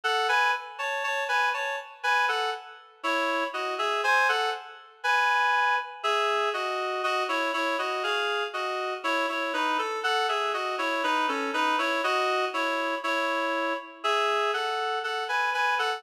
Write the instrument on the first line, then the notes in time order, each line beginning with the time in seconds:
clarinet
0.04 A4 F#5
0.29 B4 G#5
0.79 C#5 A5
1.04 C#5 A5
1.29 B4 G#5
1.54 C#5 A5
2.03 B4 G#5
2.28 A4 F#5
3.03 E4 C#5
3.54 F#4 D#5
3.78 G#4 E5
4.04 C5 G#5
4.29 A4 F#5
5.04 B4 G#5
6.03 G#4 E5
6.54 F#4 D#5
7.03 F#4 D#5
7.29 E4 C#5
7.54 E4 C#5
7.79 F#4 D#5
8.03 G#4 F5
8.53 F#4 D#5
9.04 E4 C#5
9.29 E4 C#5
9.53 D#4 B4
9.78 A4
10.03 A4 F#5
10.29 G#4 E5
10.54 F#4 D#5
10.78 E4 C#5
11.03 D#4 B4
11.28 C#4 A4
11.54 D#4 B4
11.78 E4 C#5
12.04 F#4 D#5
12.54 E4 C#5
13.04 E4 C#5
14.04 G#4 E5
14.53 A4 F#5
15.04 A4 F#5
15.29 B4 G#5
15.54 B4 G#5
15.79 A4 F#5